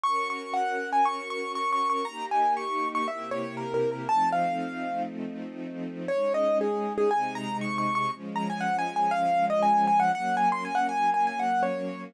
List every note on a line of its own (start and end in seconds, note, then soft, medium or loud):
0.03 2.04 C#4 medium
0.03 2.04 F#4 medium
0.03 2.04 A#4 medium
0.03 0.28 C#6 medium
0.30 0.53 C#6 medium
0.54 0.90 F#5 medium
0.93 1.05 G#5 medium
1.05 1.28 C#6 medium
1.30 1.52 C#6 medium
1.55 1.71 C#6 medium
1.72 1.88 C#6 medium
1.90 2.06 C#6 medium
2.05 3.07 A#3 medium
2.05 3.07 D#4 medium
2.05 3.07 G4 medium
2.05 2.26 A#5 medium
2.31 2.54 G#5 medium
2.57 2.88 C#6 medium
2.95 3.07 C#6 medium
3.08 4.08 C3 medium
3.08 4.08 A#3 medium
3.08 4.08 E4 medium
3.08 4.08 G4 medium
3.08 3.30 E5 medium
3.31 3.56 C#5 medium
3.57 3.73 A#4 medium
3.74 3.90 A#4 medium
3.92 4.08 A#4 medium
4.09 6.09 F3 medium
4.09 6.09 A3 medium
4.09 6.09 C4 medium
4.09 6.09 D#4 medium
4.09 4.29 A5 medium
4.32 5.03 F5 medium
6.08 7.10 G#3 medium
6.08 7.11 C#4 medium
6.08 7.10 D#4 medium
6.08 6.33 C#5 medium
6.34 6.58 D#5 medium
6.61 6.93 G#4 medium
6.98 7.10 G#4 medium
7.11 8.11 C3 medium
7.11 8.11 G#3 loud
7.11 8.11 D#4 medium
7.11 7.34 G#5 medium
7.35 7.57 A#5 medium
7.61 7.77 C#6 medium
7.78 7.94 C#6 medium
7.95 8.11 C#6 medium
8.13 10.12 F3 medium
8.13 10.12 G#3 medium
8.13 10.12 C#4 medium
8.36 8.48 A#5 medium
8.50 8.62 G#5 medium
8.61 8.76 F#5 medium
8.79 8.95 G#5 medium
8.96 9.12 G#5 medium
9.11 9.46 F5 medium
9.50 9.62 D#5 medium
9.63 9.85 G#5 medium
9.87 9.99 G#5 medium
10.00 10.12 F#5 medium
10.13 12.12 F#3 medium
10.13 12.12 A#3 loud
10.13 12.12 C#4 medium
10.13 10.35 F#5 medium
10.37 10.49 G#5 medium
10.52 10.64 C6 medium
10.65 10.77 G#5 medium
10.75 10.87 F#5 medium
10.89 11.10 G#5 medium
11.14 11.26 G#5 medium
11.27 11.39 G#5 medium
11.39 11.63 F#5 medium
11.63 12.04 C#5 medium